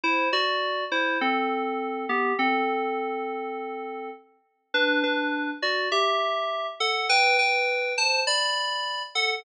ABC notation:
X:1
M:4/4
L:1/8
Q:1/4=102
K:Em
V:1 name="Electric Piano 2"
[Ec] [Fd]2 [Ec] [CA]3 [B,G] | [CA]6 z2 | [DB] [DB]2 [Fd] [Ge]3 [Af] | [Bg] [Bg]2 [ca] [db]3 [Af] |]